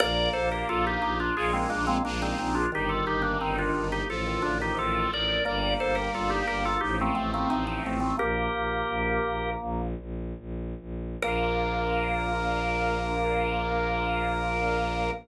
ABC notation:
X:1
M:4/4
L:1/16
Q:1/4=88
K:Bb
V:1 name="Drawbar Organ"
[Bd]2 [Ac] [GB] [FA] [EG] [EG] [DF] [F_A] [_A,C] [B,D] [A,C] [B,D] [CE] [CE] [DF] | [EG] [FA] [EG] [B,D] [CE] [DF]2 [EG] [FA]2 [DF] [EG] [FA]2 [Bd]2 | [Bd]2 [Ac] [GB] [FA] [EG] [GB] [FA] [EG] [A,C] [A,C] [A,C] [CE] [CE] [A,C] [A,C] | "^rit." [GB]8 z8 |
B16 |]
V:2 name="Drawbar Organ"
B,8 z B, _A, B, B,2 z2 | E,8 z E, D, E, E,2 z2 | B,8 z B, A, B, A,2 z2 | "^rit." B,10 z6 |
B,16 |]
V:3 name="Accordion"
B,2 D2 F2 D2 [_A,B,EF]4 [A,B,DF]4 | G,2 B,2 E2 B,2 F,2 A,2 C2 E2 | G,2 B,2 D2 B,2 F,2 A,2 C2 E2 | "^rit." z16 |
[B,DF]16 |]
V:4 name="Violin" clef=bass
B,,,2 B,,,2 B,,,2 B,,,2 B,,,2 B,,,2 B,,,2 B,,,2 | G,,,2 G,,,2 G,,,2 G,,,2 A,,,2 A,,,2 A,,,2 A,,,2 | G,,,2 G,,,2 G,,,2 G,,,2 A,,,2 A,,,2 A,,,2 A,,,2 | "^rit." B,,,2 B,,,2 B,,,2 B,,,2 B,,,2 B,,,2 B,,,2 B,,,2 |
B,,,16 |]